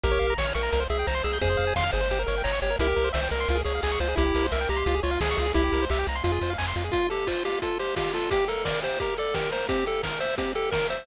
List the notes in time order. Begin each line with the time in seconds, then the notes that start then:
0.04 A#1 G4 A#4, kick, closed hi-hat
0.11 C#5
0.19 A#1 F5, open hi-hat
0.30 A#5
0.38 A#1 C#5 C#6, kick, snare
0.46 F6
0.55 A#1 A#4 C#6, open hi-hat
0.63 A#5
0.72 C2 A#4, kick, closed hi-hat
0.80 C5
0.90 C2 G#4 E5, open hi-hat
0.99 G5
1.07 C2 C5 A#5, kick, snare
1.15 C6
1.24 C2 G#4 E6, open hi-hat
1.33 G6
1.41 F2 G#4 C5, kick, closed hi-hat
1.50 C5
1.57 F2 F5, open hi-hat
1.67 G#5
1.76 F2 F5 C6, kick, snare
1.83 F6
1.92 G1 G#4 C5, open hi-hat
2.01 C5
2.10 G4, kick, closed hi-hat
2.19 A#4
2.27 G1 A#4 C#5, open hi-hat
2.38 G5
2.44 G1 C#5 A#5, kick, clap
2.52 C#6
2.62 G1 G4 C#5, open hi-hat
2.70 A#4
2.79 C2 E4 G4 A#4, kick, closed hi-hat
2.87 G4
2.96 C2 A#4, open hi-hat
3.04 C5
3.13 C2 C5 E5, kick, snare
3.23 G5
3.31 C2 A#4 A#5, open hi-hat
3.40 C6
3.48 C#2 F4, kick, closed hi-hat
3.55 G#4
3.65 C#2 G#4 C#5, open hi-hat
3.75 F5
3.83 C#2 G#4 G#5, kick, clap
3.92 C#6
4.00 C#2 F4 C5, open hi-hat
4.08 G#4
4.16 C2 E4 G4, kick, closed hi-hat
4.26 G4
4.35 C2 A#4, open hi-hat
4.44 C5
4.52 C2 A#4 E5, kick, clap
4.61 G5
4.69 C2 G4 A#5, open hi-hat
4.76 C6
4.86 C#2 F4, kick, closed hi-hat
4.95 G#4
5.03 C#2 F4 C#5, open hi-hat
5.11 F5
5.21 C#2 G#4 G#5, kick, snare
5.31 C#6
5.37 C#2 F4 G#4, open hi-hat
5.46 G#4
5.54 C2 E4 G4, kick, closed hi-hat
5.64 G4
5.72 C2 A#4, open hi-hat
5.82 C5
5.90 C2 G4 E5, kick, clap
5.99 G5
6.07 C2 A#5, open hi-hat
6.15 C6
6.24 F2 F4, kick, closed hi-hat
6.32 G#4
6.41 F2 C5, open hi-hat
6.50 F5
6.58 F2 G#5, kick, clap
6.68 C6
6.76 F2 F4, open hi-hat
6.84 G#4
6.92 F4, kick, closed hi-hat
7.10 G4 A4, open hi-hat
7.27 F4 C5, kick, clap
7.45 F4 G4, open hi-hat
7.62 F4 A4, kick, closed hi-hat
7.79 G4 C5, open hi-hat
7.96 F4 G4, kick, snare
8.14 F4 A4, open hi-hat
8.31 G4, kick, closed hi-hat
8.48 A4 A#4, open hi-hat
8.65 A#4 D5, kick, snare
8.83 G4 C5, open hi-hat
9.00 G4 A#4, kick, closed hi-hat
9.17 A4 D5, open hi-hat
9.34 G4 A#4, kick, snare
9.52 A#4 C5, open hi-hat
9.69 C4 G4, kick, closed hi-hat
9.86 G4 A4, open hi-hat
10.03 A#4, kick, snare
10.20 C5 E5, open hi-hat
10.38 C4 G4, kick, closed hi-hat
10.55 G4 A4, open hi-hat
10.71 A#4, kick, snare
10.90 C5 E5, open hi-hat